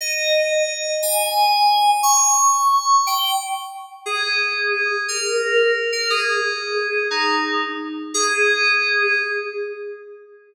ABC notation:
X:1
M:6/8
L:1/8
Q:3/8=118
K:Ab
V:1 name="Electric Piano 2"
e6 | a6 | d'6 | g2 z4 |
A6 | B5 B | A6 | E3 z3 |
A6 |]